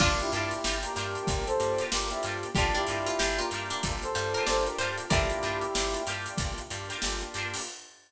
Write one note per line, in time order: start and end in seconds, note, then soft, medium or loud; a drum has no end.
0.00 0.21 G1 loud
0.00 2.53 A#3 medium
0.00 0.54 A#3 loud
0.00 0.18 D4 medium
0.00 2.12 D4 medium
0.00 2.53 D4 medium
0.00 0.54 D4 loud
0.00 0.26 D4 loud
0.00 0.18 F4 medium
0.00 2.12 F4 medium
0.00 2.53 F4 medium
0.00 0.54 F4 loud
0.00 0.26 F4 medium
0.00 2.53 G4 medium
0.00 0.54 G4 medium
0.00 0.26 G4 medium
0.00 0.26 A#4 medium
0.00 kick loud
0.00 crash loud
0.19 0.31 E4 medium
0.19 0.31 G4 medium
0.19 closed hi-hat medium
0.31 0.53 G2 loud
0.31 0.76 E4 medium
0.31 0.59 F4 medium
0.31 0.76 G4 medium
0.31 0.59 G4 medium
0.31 0.59 A#4 medium
0.31 closed hi-hat medium
0.36 0.59 D4 medium
0.51 closed hi-hat medium
0.64 0.85 G1 loud
0.64 0.91 D4 medium
0.64 0.91 F4 medium
0.64 0.91 G4 medium
0.64 0.91 A#4 medium
0.64 snare loud
0.83 0.93 A#3 medium
0.83 0.93 D4 medium
0.83 0.93 F4 medium
0.83 0.93 G4 medium
0.83 1.43 G4 medium
0.83 1.43 A#4 medium
0.83 closed hi-hat medium
0.95 1.17 G2 loud
0.95 1.49 A#3 medium
0.95 1.49 D4 medium
0.95 1.49 F4 medium
0.95 1.49 G4 medium
0.95 1.49 A#4 medium
0.95 snare soft
0.95 closed hi-hat medium
1.15 closed hi-hat medium
1.27 1.49 G1 loud
1.27 kick loud
1.27 closed hi-hat loud
1.46 1.83 A4 medium
1.46 1.83 C5 medium
1.46 closed hi-hat medium
1.59 1.81 G2 medium
1.59 1.86 A#3 loud
1.59 1.86 D4 medium
1.59 1.86 F4 medium
1.59 1.86 G4 medium
1.59 closed hi-hat medium
1.78 2.16 D4 medium
1.78 2.16 F4 medium
1.78 2.16 G4 medium
1.78 2.16 A#4 medium
1.78 closed hi-hat medium
1.91 2.13 G1 medium
1.91 2.07 A#3 medium
1.91 2.07 D4 medium
1.91 2.07 F4 medium
1.91 2.07 G4 medium
1.91 2.10 G4 medium
1.91 2.11 A#4 medium
1.91 snare loud
2.10 2.48 A#3 medium
2.10 2.48 D4 loud
2.10 2.22 E4 medium
2.10 2.48 F4 medium
2.10 2.22 G4 medium
2.10 2.48 G4 medium
2.10 snare soft
2.10 closed hi-hat medium
2.23 2.45 G2 loud
2.23 2.50 D4 medium
2.23 2.50 F4 medium
2.23 2.50 G4 medium
2.23 2.50 A#4 medium
2.23 closed hi-hat medium
2.43 closed hi-hat medium
2.55 2.77 G1 loud
2.55 3.09 A#3 loud
2.55 5.09 A#3 medium
2.55 3.09 D4 loud
2.55 5.09 D4 medium
2.55 2.75 D4 medium
2.55 3.09 F4 loud
2.55 5.09 F4 medium
2.55 2.75 F4 medium
2.55 2.82 F4 loud
2.55 3.09 G4 medium
2.55 2.74 G4 medium
2.55 5.09 G4 medium
2.55 2.82 G4 loud
2.55 2.82 A#4 loud
2.55 kick loud
2.55 closed hi-hat medium
2.59 2.82 D4 loud
2.74 3.02 D4 medium
2.74 2.86 E4 medium
2.74 2.86 G4 medium
2.74 closed hi-hat medium
2.87 3.09 G2 medium
2.87 3.37 E4 medium
2.87 3.15 F4 medium
2.87 3.37 G4 medium
2.87 3.15 G4 medium
2.87 3.15 A#4 medium
2.87 snare soft
2.87 closed hi-hat medium
2.91 3.15 D4 medium
3.06 3.18 F4 medium
3.06 snare soft
3.06 closed hi-hat medium
3.18 3.41 G1 loud
3.18 3.45 D4 medium
3.18 3.45 F4 medium
3.18 3.38 G4 medium
3.18 3.45 G4 medium
3.18 3.45 A#4 medium
3.18 snare loud
3.38 3.49 A#3 loud
3.38 3.49 D4 medium
3.38 3.49 F4 loud
3.38 3.65 F4 medium
3.38 3.49 G4 medium
3.38 3.90 G4 medium
3.38 3.90 A#4 medium
3.38 closed hi-hat medium
3.51 3.72 G2 medium
3.51 4.05 A#3 medium
3.51 4.05 D4 medium
3.51 4.05 F4 medium
3.51 4.05 G4 medium
3.51 4.05 A#4 medium
3.51 closed hi-hat medium
3.55 4.05 D4 medium
3.70 3.83 D4 medium
3.70 closed hi-hat medium
3.83 4.05 G1 loud
3.83 kick medium
3.83 closed hi-hat loud
4.02 4.43 A4 medium
4.02 4.43 C5 medium
4.02 closed hi-hat medium
4.15 4.36 G2 loud
4.15 4.42 A#3 medium
4.15 4.42 D4 medium
4.15 4.42 F4 loud
4.15 4.33 G4 medium
4.15 4.42 G4 loud
4.15 closed hi-hat medium
4.34 4.73 F4 medium
4.34 4.73 G4 medium
4.34 4.46 A#4 medium
4.34 4.73 A#4 medium
4.34 closed hi-hat medium
4.39 4.73 D4 medium
4.46 4.68 G1 loud
4.46 4.63 A#3 medium
4.46 4.63 D4 loud
4.46 4.63 F4 medium
4.46 4.63 G4 medium
4.46 4.65 A4 medium
4.46 4.65 C5 medium
4.46 4.77 D5 medium
4.46 snare loud
4.66 5.03 A#3 medium
4.66 5.03 D4 medium
4.66 5.03 F4 medium
4.66 4.78 G4 medium
4.66 5.03 G4 medium
4.66 4.78 A#4 medium
4.66 closed hi-hat medium
4.78 5.00 G2 medium
4.78 5.05 D4 medium
4.78 5.05 F4 loud
4.78 5.05 G4 medium
4.78 5.05 A#4 medium
4.78 5.06 C5 medium
4.78 closed hi-hat medium
4.97 closed hi-hat medium
5.10 5.32 G1 loud
5.10 5.64 A#3 loud
5.10 7.64 A#3 medium
5.10 5.64 D4 loud
5.10 7.64 D4 medium
5.10 5.37 D4 loud
5.10 6.02 E4 medium
5.10 5.64 F4 loud
5.10 7.64 F4 medium
5.10 5.37 F4 loud
5.10 5.64 G4 loud
5.10 7.64 G4 medium
5.10 5.37 G4 loud
5.10 6.02 G4 medium
5.10 5.37 A#4 medium
5.10 6.32 A#4 medium
5.10 6.32 D5 medium
5.10 kick loud
5.10 closed hi-hat loud
5.30 snare soft
5.30 closed hi-hat medium
5.41 5.64 G2 loud
5.41 5.68 D4 medium
5.41 5.68 F4 medium
5.41 5.68 G4 medium
5.41 5.68 A#4 medium
5.41 closed hi-hat medium
5.61 closed hi-hat medium
5.73 5.96 G1 loud
5.73 6.00 D4 medium
5.73 6.00 F4 medium
5.73 6.00 G4 medium
5.73 6.00 A#4 medium
5.73 snare loud
5.94 6.04 A#3 medium
5.94 6.04 D4 medium
5.94 6.04 F4 loud
5.94 6.04 G4 loud
5.94 closed hi-hat medium
6.06 6.28 G2 medium
6.06 6.60 A#3 medium
6.06 6.60 D4 medium
6.06 6.61 D4 medium
6.06 6.60 F4 medium
6.06 6.61 F4 medium
6.06 6.60 G4 medium
6.06 6.61 G4 medium
6.06 6.61 A#4 medium
6.06 closed hi-hat medium
6.26 closed hi-hat medium
6.38 6.60 G1 medium
6.38 kick loud
6.38 closed hi-hat loud
6.58 closed hi-hat medium
6.70 6.92 G2 loud
6.70 6.97 A#3 medium
6.70 6.97 D4 medium
6.70 6.97 F4 medium
6.70 6.97 G4 medium
6.70 closed hi-hat medium
6.89 7.26 D4 medium
6.89 7.26 F4 medium
6.89 7.26 G4 medium
6.89 7.26 A#4 medium
6.89 closed hi-hat medium
7.02 7.24 G1 loud
7.02 7.17 A#3 medium
7.02 7.17 D4 medium
7.02 7.17 F4 medium
7.02 7.17 G4 loud
7.02 snare loud
7.21 7.59 A#3 medium
7.21 7.59 D4 medium
7.21 7.59 F4 medium
7.21 7.59 G4 loud
7.21 snare soft
7.21 closed hi-hat medium
7.34 7.56 G2 medium
7.34 7.62 F4 medium
7.34 7.62 G4 medium
7.34 7.62 A#4 medium
7.34 closed hi-hat medium
7.38 7.62 D4 medium
7.54 open hi-hat medium